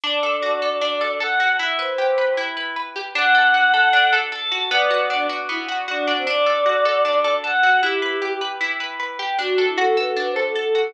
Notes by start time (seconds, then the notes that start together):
0.04 D4 D5
0.23 A4
0.43 F#4
0.62 A4
0.81 D4
1.01 A4
1.20 A4 F#5
1.40 F#4
1.59 E4 E5
1.79 B4 C5
1.89 C5
1.98 G4
2.18 B4
2.37 E4
2.57 B4
2.76 B4
2.96 G4
3.15 D4 F#5
3.35 A4
3.54 F#4
3.74 A4
3.93 D4
4.13 A4
4.32 A4 A5
4.52 F#4
4.71 B3 D5
4.91 F#4
5.10 D4
5.29 F#4
5.49 B3 E4
5.69 F#4
5.88 D4 F#4
6.07 D4
6.17 C4
6.27 D4 D5
6.46 A4
6.66 F#4
6.85 A4
7.05 D4
7.24 A4
7.44 A4 F#5
7.63 F#4
7.83 E4 G4
8.02 B4
8.22 G4
8.41 B4
8.61 E4
8.80 B4
9.00 B4
9.19 G4
9.39 D4 F#4
9.58 A4
9.68 E4
9.78 F#4 A4
9.97 A4 B4
10.07 A4
10.16 D4 B4
10.30 C5
10.36 A4
10.43 A4
10.56 A4
10.75 F#4